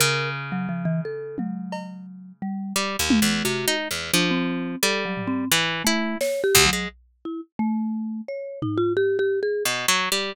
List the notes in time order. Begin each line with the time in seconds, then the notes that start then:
0.00 C#3 A#4
0.52 F#3
0.69 F3
0.85 E3
1.05 A4
1.38 F#3, high tom
1.72 cowbell
2.42 G3
2.76 G3
2.99 D#2
3.10 high tom
3.22 E2
3.45 C3 F#4
3.68 D#4
3.91 E2
4.14 F3 D4
4.31 C4
4.83 G3 A4
5.05 F#3
5.17 floor tom
5.27 C4
5.52 E3
5.84 A3 E4
6.21 C#5, snare
6.44 G4
6.55 D2, kick
6.66 F#3
6.73 G#3
7.25 E4
7.59 A3
8.28 C#5
8.62 D#4, floor tom
8.78 F4
8.97 G4
9.19 G4
9.43 G#4
9.65 B2
9.88 F#3
10.12 G3